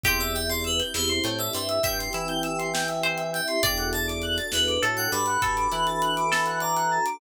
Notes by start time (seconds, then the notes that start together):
0.03 E2 C4 E4 G4 C5 G5, kick, closed hi-hat
0.19 D5 E5, closed hi-hat
0.35 E5 G5, closed hi-hat
0.50 D5 C6, closed hi-hat
0.64 B4 E6, closed hi-hat
0.80 G6, closed hi-hat
0.94 E2 E3 C5 E6, snare
1.08 C6, closed hi-hat
1.24 A2 A3 G5, closed hi-hat
1.39 D5 E5, closed hi-hat
1.53 G2 G3 C5 E5, closed hi-hat
1.69 E5, closed hi-hat
1.83 G2 G3 E5 G5, kick, closed hi-hat
1.99 C6, closed hi-hat
2.13 E3 E4 E6, closed hi-hat
2.28 G6, closed hi-hat
2.43 E6, closed hi-hat
2.59 C6, closed hi-hat
2.74 G5, snare, closed hi-hat
2.88 E5, closed hi-hat
3.03 C5, closed hi-hat
3.18 E5, closed hi-hat
3.33 E5 G5, closed hi-hat
3.48 C6, closed hi-hat
3.63 E2 D4 F#4 A4 D5 G5, kick, closed hi-hat
3.77 F#5, closed hi-hat
3.93 D5 A5, closed hi-hat
4.08 D6, closed hi-hat
4.22 F#6, closed hi-hat
4.38 A6, closed hi-hat
4.52 E2 E3 B4 F#6, snare
4.68 D6, closed hi-hat
4.82 A2 A3 A4 A5, closed hi-hat
4.97 F#5 G5, closed hi-hat
5.12 G2 G3 D5 B5, closed hi-hat
5.26 F#5, closed hi-hat
5.42 G2 G3 A4 A5, kick, closed hi-hat
5.57 D6, closed hi-hat
5.72 E3 E4 F#6, closed hi-hat
5.87 A6, closed hi-hat
6.02 F#6, closed hi-hat
6.17 D6, closed hi-hat
6.32 A4 A5, snare
6.46 F#5, closed hi-hat
6.60 D5 A#5, closed hi-hat
6.76 F#5, closed hi-hat
6.91 A5
7.06 D6, closed hi-hat